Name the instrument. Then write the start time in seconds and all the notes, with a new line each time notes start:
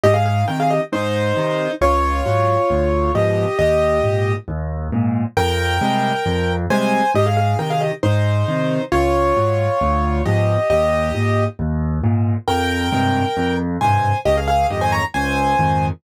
acoustic grand piano
0.04 G#2 G4 D#5
0.14 G#4 F5
0.26 G#4 F5
0.48 C3 D#3 A#4 G5
0.60 G#4 F5
0.70 G4 D#5
0.92 G#2 D#4 C5
1.37 C3 D#3
1.81 C#2 F4 C#5
2.26 G#2 F#3
2.70 D2
3.15 G#2 B2 F3 G4 D#5
3.59 D#2 G4 D#5
4.04 G#2 A#2
4.48 D#2
4.92 G#2 A#2
5.37 F2 A#4 G5
5.81 C3 G3 G#3
6.26 F2
6.70 C3 G3 G#3 C5 G#5
7.15 G#2 G4 D#5
7.26 G#4 F5
7.37 G#4 F5
7.59 C3 D#3 A#4 G5
7.70 G#4 F5
7.81 G4 D#5
8.03 G#2 D#4 C5
8.48 C3 D#3
8.92 C#2 F4 C#5
9.37 G#2 F#3
9.81 D2
10.25 G#2 B2 F3 G4 D#5
10.70 D#2 G4 D#5
11.15 G#2 A#2
11.59 D#2
12.04 G#2 A#2
12.48 F2 A#4 G5
12.92 G2 G#2 C3
13.37 F2
13.81 G2 G#2 C3 C5 G#5
14.25 C#2 G4 D#5
14.37 G#4 F5
14.48 G#4 F5
14.70 F2 G#2 D#3 G4 D#5
14.81 C5 G#5
14.92 C#5 A#5
15.14 C#2 C5 G#5
15.59 F2 G#2 D#3